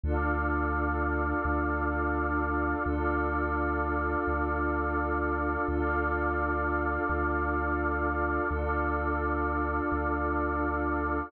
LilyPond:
<<
  \new Staff \with { instrumentName = "Pad 5 (bowed)" } { \time 4/4 \key d \dorian \tempo 4 = 85 <d' f' a'>1 | <d' f' a'>1 | <d' f' a'>1 | <d' f' a'>1 | }
  \new Staff \with { instrumentName = "Pad 2 (warm)" } { \time 4/4 \key d \dorian <a' d'' f''>1 | <a' d'' f''>1 | <a' d'' f''>1 | <a' d'' f''>1 | }
  \new Staff \with { instrumentName = "Synth Bass 2" } { \clef bass \time 4/4 \key d \dorian d,2 d,2 | d,2 d,2 | d,2 d,2 | d,2 d,2 | }
>>